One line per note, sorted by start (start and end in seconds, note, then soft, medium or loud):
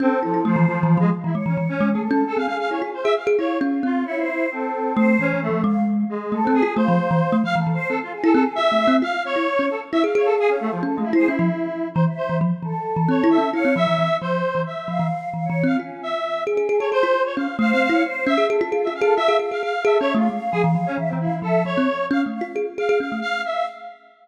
0.00 0.19 C4 loud
0.00 0.10 C#4 loud
0.00 0.40 A4 medium
0.23 0.44 F3 medium
0.23 0.33 E4 medium
0.34 0.44 E4 medium
0.45 0.65 F3 loud
0.45 0.55 A3 loud
0.45 0.76 C5 medium
0.56 0.66 E3 loud
0.68 0.82 E3 medium
0.68 0.98 F3 loud
0.83 0.97 E3 loud
0.88 1.08 F5 medium
0.97 1.11 F3 loud
0.97 1.10 G#3 loud
1.24 1.34 E3 medium
1.24 1.35 E4 medium
1.33 1.45 G#3 medium
1.33 1.84 C#5 medium
1.46 1.56 E3 medium
1.46 1.57 C#4 medium
1.57 1.68 E3 medium
1.69 1.89 C#4 loud
1.81 1.94 G#3 loud
1.91 2.03 G#4 soft
1.91 2.01 A4 medium
1.95 2.09 A3 medium
2.02 2.22 A4 loud
2.11 2.24 C#4 loud
2.27 2.88 G#4 medium
2.27 2.37 A4 medium
2.37 2.47 C4 medium
2.37 2.46 F5 medium
2.47 2.58 C#4 soft
2.47 2.57 F5 medium
2.60 2.70 F5 medium
2.71 2.81 E4 medium
2.71 2.81 C#5 medium
2.82 2.92 F4 medium
2.94 3.04 C5 medium
3.04 3.15 G#4 loud
3.04 3.14 E5 loud
3.17 3.27 F5 medium
3.27 3.37 G#4 loud
3.37 3.59 E4 medium
3.37 3.98 F4 medium
3.37 3.58 C#5 medium
3.61 3.81 C#4 loud
3.83 4.03 C4 medium
3.83 4.05 F4 medium
4.05 4.46 E4 medium
4.05 4.15 C#5 medium
4.18 4.49 C5 medium
4.51 5.12 C4 medium
4.51 4.93 A4 medium
4.95 5.17 A3 loud
4.95 5.25 C5 loud
5.19 5.33 E3 medium
5.19 5.40 C#4 loud
5.34 5.47 E3 medium
5.42 5.62 A3 loud
5.49 5.63 F3 medium
5.63 6.04 G#3 loud
5.63 5.84 F5 medium
6.09 6.40 G#3 medium
6.32 6.46 A3 medium
6.32 6.53 A4 loud
6.43 6.53 C4 medium
6.43 6.61 C4 loud
6.54 6.74 G#4 loud
6.63 6.76 F4 loud
6.76 6.87 A3 loud
6.76 7.36 C5 medium
6.76 7.38 F5 medium
6.88 6.98 F3 loud
7.11 7.21 E3 loud
7.32 7.42 A3 loud
7.42 7.54 F3 medium
7.42 7.56 F5 loud
7.42 7.55 F5 loud
7.56 7.66 E3 medium
7.56 7.71 A4 medium
7.67 7.77 E3 medium
7.74 7.87 C5 loud
7.89 8.00 C4 soft
7.89 7.99 A4 medium
8.03 8.13 F4 medium
8.12 8.52 G#4 loud
8.24 8.34 E4 loud
8.24 8.33 A4 loud
8.33 8.45 C4 loud
8.33 8.43 A4 loud
8.55 8.72 F4 medium
8.55 8.96 E5 loud
8.72 8.85 A3 medium
8.78 8.88 C5 medium
8.88 9.01 C4 loud
9.02 9.12 F4 medium
9.02 9.23 F5 loud
9.25 9.75 C#5 medium
9.25 9.66 C#5 loud
9.36 9.46 E4 medium
9.59 9.69 C#4 medium
9.70 9.80 A4 medium
9.92 10.03 E4 medium
9.92 10.02 E5 loud
10.04 10.14 G#4 medium
10.04 10.14 F5 soft
10.13 10.56 G#4 loud
10.13 10.26 C#5 medium
10.13 10.74 F5 medium
10.25 10.35 A4 medium
10.39 10.50 G#4 loud
10.48 10.59 C#4 medium
10.60 10.71 A3 loud
10.72 10.82 F3 medium
10.82 10.96 C#4 medium
10.82 10.95 A4 medium
10.95 11.05 G#3 medium
10.95 11.11 A3 medium
10.95 11.11 F4 medium
11.04 11.14 E4 medium
11.13 11.27 E4 loud
11.13 11.27 C5 loud
11.18 11.28 G#4 medium
11.27 11.38 C#4 medium
11.27 11.88 E4 medium
11.39 11.49 F3 loud
11.94 12.06 E3 loud
11.94 12.04 C5 medium
12.07 12.37 E5 medium
12.17 12.37 C5 medium
12.29 12.40 E3 medium
12.41 12.51 F3 loud
12.63 12.73 E3 medium
12.63 13.45 A4 medium
12.96 13.07 E3 loud
13.08 13.22 C4 medium
13.08 13.29 C#5 medium
13.24 13.37 E4 loud
13.30 13.50 E5 medium
13.38 13.52 C#4 medium
13.53 13.64 E4 medium
13.53 13.73 C#5 loud
13.53 13.74 F5 medium
13.65 13.75 C4 medium
13.76 13.86 F3 medium
13.76 14.17 E5 loud
13.87 13.97 E3 medium
13.98 14.09 E3 medium
14.21 14.42 F3 medium
14.21 14.62 C5 medium
14.55 14.65 E3 medium
14.66 15.07 E5 medium
14.88 14.98 F3 medium
14.88 15.29 F5 loud
14.99 15.10 E3 medium
15.34 15.47 E3 medium
15.34 15.44 F5 medium
15.45 15.65 C#5 medium
15.50 15.63 E3 medium
15.64 15.77 C4 medium
15.64 15.76 F4 medium
15.64 15.76 F5 medium
15.79 16.00 C#4 medium
15.79 16.20 F4 medium
16.03 16.43 E5 medium
16.47 16.61 C#4 medium
16.47 16.57 G#4 medium
16.57 16.67 G#4 medium
16.62 16.76 G#4 medium
16.69 16.79 G#4 loud
16.76 16.90 A4 medium
16.76 16.90 C#5 medium
16.80 16.90 G#4 medium
16.92 17.02 G#4 medium
16.92 17.22 C5 loud
17.03 17.13 F4 medium
17.25 17.36 C#5 medium
17.36 17.47 C#4 medium
17.36 17.57 F5 medium
17.57 17.72 A3 loud
17.57 17.88 C5 loud
17.57 17.70 F5 medium
17.72 17.87 C4 medium
17.72 17.82 F5 loud
17.83 18.03 F5 loud
17.89 18.03 E4 medium
17.89 18.02 C#5 medium
18.05 18.25 C5 medium
18.26 18.37 C#4 loud
18.26 18.47 E5 loud
18.26 18.47 E5 medium
18.38 18.48 G#4 medium
18.50 18.60 G#4 loud
18.50 18.70 A4 medium
18.61 18.71 F4 loud
18.71 18.85 F4 medium
18.71 18.86 G#4 medium
18.83 19.01 F4 medium
18.83 18.94 E5 medium
18.89 19.03 C#4 soft
18.95 19.15 F5 medium
19.01 19.15 G#4 loud
19.01 19.14 A4 loud
19.16 19.28 F4 medium
19.16 19.37 E5 loud
19.16 19.77 F5 medium
19.28 19.38 G#4 medium
19.39 19.50 G#4 medium
19.51 19.62 G#4 medium
19.51 19.62 F5 medium
19.63 19.73 G#4 medium
19.63 19.83 F5 medium
19.84 19.98 G#4 loud
19.84 19.98 A4 medium
19.84 19.98 E5 medium
19.98 20.14 C#4 medium
19.98 20.14 C#5 loud
19.98 20.12 E5 medium
20.14 20.28 A3 loud
20.14 20.27 F4 medium
20.14 20.30 F5 loud
20.30 20.40 G#3 medium
20.30 20.91 F5 loud
20.52 20.63 F3 medium
20.52 20.62 G#4 loud
20.64 20.74 E3 loud
20.75 20.85 F3 medium
20.86 20.97 C#4 loud
20.98 21.11 E3 medium
20.98 21.09 E5 medium
21.09 21.19 C4 medium
21.13 21.27 E3 medium
21.20 21.40 E4 soft
21.20 21.32 F5 medium
21.28 21.41 E3 medium
21.42 21.63 F3 medium
21.42 21.63 A4 medium
21.42 21.64 E5 loud
21.65 21.75 F3 medium
21.65 22.06 C#5 medium
21.77 21.88 C4 medium
22.11 22.24 C#4 loud
22.11 22.22 F5 medium
22.26 22.40 A3 medium
22.34 22.44 F5 medium
22.41 22.55 F4 medium
22.41 22.55 F5 medium
22.56 22.66 G#4 medium
22.78 22.88 G#4 medium
22.78 22.99 F5 medium
22.89 22.99 G#4 loud
23.00 23.10 C#4 medium
23.00 23.20 F5 medium
23.12 23.22 A3 medium
23.22 23.42 F5 loud
23.22 23.38 F5 loud
23.39 23.52 F5 medium
23.45 23.65 E5 medium
23.52 23.66 F5 loud